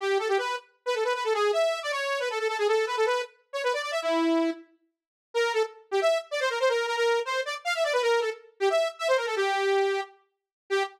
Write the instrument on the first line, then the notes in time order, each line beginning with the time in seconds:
lead 2 (sawtooth)
0.01 G4
0.19 A4
0.29 G4
0.38 B4
0.86 B4
0.95 A4
1.04 B4
1.15 B4
1.24 A4
1.34 G#4
1.53 E5
1.83 D5
1.92 C#5
2.20 B4
2.30 A4
2.39 A4
2.48 A4
2.58 G#4
2.68 A4
2.87 B4
2.97 A4
3.06 B4
3.53 C#5
3.63 B4
3.73 D5
3.82 D5
3.91 E5
4.02 E4
5.34 A#4
5.54 A4
5.91 G4
6.01 E5
6.31 D5
6.40 C5
6.50 A#4
6.60 C5
6.69 A#4
6.87 A#4
6.97 A#4
7.25 C5
7.45 D5
7.65 F5
7.75 E5
7.84 D5
7.93 B4
8.02 A#4
8.21 A4
8.60 G4
8.70 E5
8.99 E5
9.08 C5
9.17 A#4
9.26 A4
9.36 G4
10.70 G4